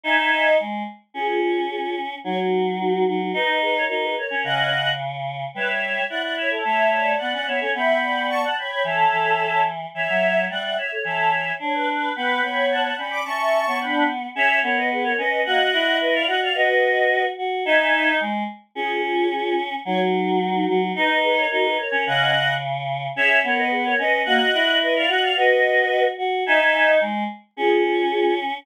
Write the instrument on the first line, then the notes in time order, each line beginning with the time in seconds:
choir aahs
0.04 D#4 E5 G#5
0.18 D#4
0.32 D#5
0.60 G#3
1.14 C#4 F4 G#4
1.41 F4 G#4
1.71 F4 G#4
2.24 F#3 D#4 F#4 C#5
2.79 D#4 F#4
2.93 D#4 F#4
3.08 F#3 D#4 F#4
3.22 D#4 F#4
3.33 D#4 B4 D#5
3.62 G#4 B4
3.76 A#4 C#5
3.89 D#4 F#4 A#4
4.03 G#4 B4
4.18 A#4 C#5
4.30 C#4
4.44 C#3 C#4 D#5 F#5
5.54 G3 B4 C#5 E5
5.68 C#5
5.82 C#5
6.10 E4 D5 F#5
6.22 D5 F#5
6.36 C#5 E5
6.50 A4 C#5
6.64 A3 C#5 E5
6.92 D5
7.18 B3 D5 F#5
7.33 C#4 D5 F#5
7.46 B3 C#5 E5
7.61 C#4 A4 C#5
7.74 B3 E5 G5 B5
8.02 D5
8.29 A5 C#6
8.43 F#5 A5
8.57 C#5 G5 B5
8.71 G5 B5
8.84 E3 A4 C#5 E5
9.12 E3
9.94 E3 C#5 E5
10.09 F#3
10.50 G3 D5 E5 F#5
10.63 D5 E5 F#5
10.77 C#5 E5
10.92 A4 C#5
11.04 E3 A4 C#5 E5
11.59 D4 C#5
11.74 B4
11.88 B4
12.15 B3 B4 G5 B5
12.43 B3 C#5
12.70 F#5 A5
12.84 F#5 A5
12.98 C#4 D5 G5 B5
13.11 B5 D6
13.25 C#4 E5 A5 C#6
13.67 B3 C#5
13.80 D4 G5 B5
14.35 C#4 G#4 C#5 E5
14.63 B3 A#4 C#5
14.76 B4 D#5
14.91 G#4 B4
15.04 A#4 C#5
15.18 C#4 B4 D#5
15.45 A#3 F#4 D#5 F#5
15.73 E4
16.01 B4 D#5
16.14 D5 F5
16.27 F#4 D#5 F#5
16.42 D5 F5
16.55 F#4 B4 D#5
17.38 F#4
17.65 D#4 E5 G#5
17.79 D#4
17.93 D#4
18.20 G#3
18.75 C#4 F4 G#4
19.03 F4 G#4
19.31 F4 G#4
19.85 F#3 D#4 F#4 C#5
20.40 D#4 F#4
20.55 D#4 F#4
20.68 F#3 D#4 F#4
20.82 D#4 F#4
20.95 D#4 B4 D#5
21.23 G#4 B4
21.38 A#4 C#5
21.51 D#4 F#4 A#4
21.64 G#4 B4
21.78 A#4 C#5
21.92 C#4
22.06 C#3 C#4 D#5 F#5
23.16 C#4 G#4 C#5 E5
23.44 B3 A#4 C#5
23.58 B4 D#5
23.71 G#4 B4
23.85 A#4 C#5
23.99 C#4 B4 D#5
24.25 A#3 F#4 D#5 F#5
24.54 E4
24.81 B4 D#5
24.96 D5 F5
25.08 F#4 D#5 F#5
25.23 D5 F5
25.36 F#4 B4 D#5
26.18 F#4
26.46 D#4 E5 G#5
26.60 D#5
26.74 D#4
27.01 G#3
27.57 C#4 F4 G#4
27.84 F4 G#4
28.11 F4 G#4